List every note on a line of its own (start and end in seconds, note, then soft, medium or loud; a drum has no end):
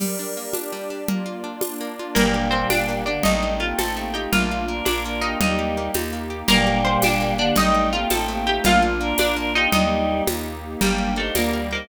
0.00 0.72 G3 medium
0.00 0.53 G4 medium
0.00 0.55 A#4 medium
0.00 0.53 D5 medium
0.00 crash medium
0.00 low conga medium
0.19 0.53 D4 medium
0.37 1.05 A#3 medium
0.53 1.07 D4 medium
0.53 0.90 D4 medium
0.53 1.07 G4 medium
0.53 1.07 D5 medium
0.53 tambourine medium
0.53 high conga medium
0.72 1.07 G3 medium
0.90 1.07 D4 medium
1.08 1.80 A#3 medium
1.08 1.62 A#3 medium
1.08 1.63 F4 medium
1.08 1.62 D5 medium
1.08 low conga medium
1.26 1.62 F4 medium
1.44 2.12 D4 medium
1.61 2.15 A#3 medium
1.61 2.15 D4 medium
1.61 1.99 F4 medium
1.61 2.16 D5 medium
1.61 tambourine medium
1.61 high conga medium
1.81 2.15 A#3 medium
1.99 2.17 F4 medium
2.15 2.65 G1 loud
2.15 3.02 A#2 medium
2.15 3.02 G3 loud
2.15 2.46 A#3 medium
2.15 2.51 A#3 medium
2.15 3.23 A#3 medium
2.15 3.23 D4 medium
2.15 3.23 G4 medium
2.15 2.46 A#4 medium
2.15 low conga medium
2.34 3.06 G4 medium
2.51 2.88 A#3 medium
2.51 2.67 C4 medium
2.51 2.67 C5 medium
2.70 3.19 G1 medium
2.70 3.21 D4 medium
2.70 3.03 D4 medium
2.70 3.03 D5 medium
2.70 tambourine medium
2.70 high conga medium
2.89 3.23 A#3 medium
3.06 3.23 D3 medium
3.06 3.23 A#3 medium
3.06 3.23 D4 medium
3.06 3.24 G4 medium
3.06 3.23 D5 medium
3.23 3.73 A1 loud
3.23 3.59 G3 medium
3.23 4.31 A3 medium
3.23 3.59 A3 loud
3.23 4.31 C4 medium
3.23 3.53 D#4 medium
3.23 4.31 D#4 medium
3.23 3.59 D#4 loud
3.23 3.53 D#5 medium
3.23 low conga medium
3.43 4.14 D#4 medium
3.60 3.96 A3 medium
3.60 3.77 A#3 medium
3.60 3.77 F4 medium
3.60 3.77 G4 medium
3.60 3.77 F5 medium
3.78 4.27 A1 medium
3.78 3.95 C4 medium
3.78 4.30 C4 medium
3.78 4.08 A4 soft
3.78 3.95 A4 medium
3.78 4.08 A5 medium
3.78 tambourine medium
3.78 high conga medium
3.96 4.31 A3 medium
3.96 4.14 A#3 medium
3.96 4.14 G4 medium
4.14 4.31 A3 medium
4.14 4.32 D#4 medium
4.14 4.31 F4 medium
4.14 4.31 G4 medium
4.14 4.31 G5 medium
4.31 4.81 A#1 medium
4.31 4.65 A3 medium
4.31 5.38 A#3 medium
4.31 4.68 A#3 medium
4.31 5.38 D4 medium
4.31 5.38 F4 medium
4.31 4.65 F4 loud
4.31 4.78 F4 medium
4.31 4.78 F5 medium
4.31 low conga medium
4.51 5.37 F4 medium
4.67 5.05 A#3 medium
4.67 4.85 D4 medium
4.67 4.85 A#4 medium
4.85 5.35 A#1 medium
4.85 5.02 D4 medium
4.85 5.03 D4 medium
4.85 5.38 D4 medium
4.85 5.03 A#4 medium
4.85 5.02 D5 medium
4.85 tambourine medium
4.85 high conga medium
5.05 5.21 A#3 medium
5.05 5.20 D4 medium
5.05 5.20 A#4 medium
5.21 5.77 A#3 medium
5.21 5.38 A#3 medium
5.21 5.38 D#4 medium
5.21 5.38 G4 medium
5.21 5.38 D#5 medium
5.40 5.89 D#2 medium
5.40 5.91 G3 medium
5.40 6.48 A#3 medium
5.40 5.91 D#4 loud
5.40 6.48 D#4 medium
5.40 6.12 D#4 medium
5.40 6.48 G4 medium
5.40 6.12 D#5 medium
5.40 low conga medium
5.59 6.30 G4 medium
5.77 6.12 A#3 medium
5.94 6.43 D#2 medium
5.94 6.46 D#4 medium
5.94 tambourine medium
5.94 high conga medium
6.13 6.47 A#3 medium
6.30 6.47 G4 medium
6.48 6.98 G1 loud
6.48 7.34 A#2 loud
6.48 7.34 G3 loud
6.48 6.84 A#3 loud
6.48 6.80 A#3 medium
6.48 7.56 A#3 medium
6.48 7.56 D4 medium
6.48 7.56 G4 medium
6.48 6.80 A#4 loud
6.48 low conga medium
6.67 7.38 G4 medium
6.85 7.20 A#3 medium
6.85 7.01 C5 medium
6.85 7.01 C6 medium
7.02 7.52 G1 medium
7.02 7.54 D4 medium
7.02 7.37 D4 medium
7.02 7.37 D5 medium
7.02 tambourine medium
7.02 high conga medium
7.21 7.55 A#3 medium
7.37 7.53 D3 loud
7.37 7.53 A#3 loud
7.37 7.56 D4 medium
7.37 7.55 G4 medium
7.37 7.56 D5 medium
7.56 8.05 A1 loud
7.56 7.90 G3 loud
7.56 7.93 A3 loud
7.56 8.63 A3 medium
7.56 8.63 C4 medium
7.56 8.63 D#4 medium
7.56 7.90 D#4 loud
7.56 7.87 D#4 medium
7.56 7.87 D#5 medium
7.56 low conga loud
7.75 8.46 D#4 medium
7.92 8.28 A3 medium
7.92 8.09 A#3 loud
7.92 8.09 F4 medium
7.92 8.09 G4 loud
7.92 8.09 F5 medium
8.10 8.59 A1 medium
8.10 8.27 C4 loud
8.10 8.62 C4 medium
8.10 8.40 A4 medium
8.10 8.27 A4 loud
8.10 8.40 A5 medium
8.10 tambourine medium
8.10 high conga medium
8.28 8.63 A3 medium
8.28 8.48 A#3 loud
8.28 8.48 G4 loud
8.46 8.64 A3 medium
8.46 8.64 D#4 medium
8.46 8.64 F4 medium
8.46 8.64 G4 medium
8.46 8.64 G5 medium
8.64 9.13 A#1 loud
8.64 8.82 A3 loud
8.64 9.00 A#3 loud
8.64 9.71 A#3 medium
8.64 9.71 D4 medium
8.64 8.82 F4 loud
8.64 9.71 F4 medium
8.64 9.11 F4 medium
8.64 9.11 F5 loud
8.64 low conga loud
8.82 9.56 F4 medium
9.00 9.36 A#3 medium
9.00 9.18 D4 loud
9.00 9.18 A#4 loud
9.18 9.67 A#1 medium
9.18 9.35 D4 loud
9.18 9.35 D4 medium
9.18 9.70 D4 medium
9.18 9.35 A#4 loud
9.18 9.35 D5 medium
9.18 tambourine medium
9.18 high conga loud
9.36 9.71 A#3 medium
9.36 9.52 D4 loud
9.36 9.52 A#4 loud
9.55 9.70 A#3 loud
9.55 9.72 D#4 medium
9.55 9.73 F4 medium
9.55 9.70 G4 loud
9.55 9.72 D#5 medium
9.72 10.22 D#2 loud
9.72 10.22 G3 loud
9.72 10.81 A#3 medium
9.72 10.22 D#4 loud
9.72 10.43 D#4 medium
9.72 10.81 D#4 medium
9.72 10.81 G4 medium
9.72 10.43 D#5 medium
9.72 low conga loud
10.27 10.76 D#2 medium
10.27 tambourine medium
10.27 high conga medium
10.81 11.30 G1 loud
10.81 11.13 G3 medium
10.81 11.14 A#3 medium
10.81 11.35 A#3 medium
10.81 11.35 D4 medium
10.81 11.14 G4 loud
10.81 11.13 G4 medium
10.81 11.35 G4 medium
10.81 11.16 A#4 medium
10.81 low conga medium
10.98 11.70 G5 medium
11.16 11.34 A3 medium
11.16 11.34 D#4 medium
11.16 11.34 A4 medium
11.16 11.53 A#4 medium
11.16 11.34 C5 medium
11.35 11.84 D2 medium
11.35 11.88 G3 medium
11.35 11.88 A#3 medium
11.35 11.69 A#3 medium
11.35 11.50 F4 medium
11.35 11.88 G4 medium
11.35 11.69 A#4 medium
11.35 11.50 D5 medium
11.35 11.86 D5 medium
11.35 tambourine medium
11.35 high conga medium
11.52 11.69 F4 medium
11.52 11.88 A#4 medium
11.52 11.69 D5 medium
11.70 11.88 A#3 medium
11.70 11.86 D#4 medium
11.70 11.88 A#4 medium
11.70 11.86 C5 medium
11.70 11.88 G5 medium